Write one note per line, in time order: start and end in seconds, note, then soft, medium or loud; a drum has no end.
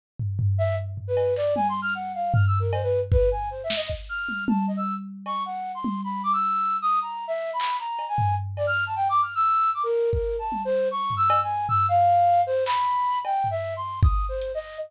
0.19 floor tom medium
0.39 floor tom medium
0.58 0.76 E5 loud
0.97 floor tom medium
1.08 1.34 B4 medium
1.17 cowbell medium
1.36 1.54 D5 loud
1.36 clap medium
1.56 1.67 G#5 medium
1.56 high tom medium
1.69 1.81 C6 medium
1.82 1.94 F6 loud
1.95 2.12 F#5 medium
2.14 2.32 F5 medium
2.34 2.45 F6 medium
2.34 floor tom loud
2.47 2.59 E6 medium
2.60 2.71 A#4 medium
2.73 2.82 C5 medium
2.73 cowbell loud
2.83 3.00 B4 medium
3.12 3.29 B4 medium
3.12 kick loud
3.31 3.49 G#5 medium
3.51 3.62 C5 soft
3.64 3.75 E5 medium
3.70 snare loud
3.76 3.88 D#5 loud
3.90 kick medium
4.09 4.44 F6 medium
4.29 high tom medium
4.48 4.66 A5 soft
4.48 high tom loud
4.68 4.76 D#5 medium
4.77 4.94 E6 medium
5.26 5.43 C#6 medium
5.26 cowbell medium
5.46 5.72 F#5 medium
5.75 6.01 C6 medium
5.84 high tom medium
6.04 6.22 B5 medium
6.23 6.32 D6 medium
6.33 6.77 E6 medium
6.82 6.99 D#6 loud
7.02 7.25 A#5 soft
7.28 7.51 E5 loud
7.53 7.77 B5 medium
7.60 clap medium
7.79 8.06 A#5 medium
7.99 cowbell medium
8.08 8.35 G#5 medium
8.18 floor tom medium
8.57 8.66 D5 loud
8.57 cowbell medium
8.67 8.84 F6 loud
8.86 8.95 A5 medium
8.96 9.08 G5 medium
9.09 9.21 D6 medium
9.22 9.34 F6 medium
9.35 9.70 E6 loud
9.74 9.83 D6 medium
9.83 10.10 A#4 medium
10.13 10.36 A#4 medium
10.13 kick medium
10.39 10.62 A5 medium
10.52 high tom medium
10.65 10.88 C5 loud
10.91 11.14 C#6 medium
11.10 floor tom medium
11.17 11.40 E6 loud
11.30 cowbell loud
11.43 11.66 G#5 medium
11.69 11.86 E6 loud
11.69 floor tom medium
11.89 12.41 F5 loud
12.47 12.64 C5 loud
12.66 13.19 B5 loud
12.66 clap medium
13.25 13.48 G5 medium
13.25 cowbell medium
13.44 floor tom medium
13.51 13.74 E5 loud
13.76 14.00 C6 medium
14.03 14.26 D#6 medium
14.03 kick loud
14.29 14.52 C5 medium
14.42 closed hi-hat loud
14.55 14.78 D#5 loud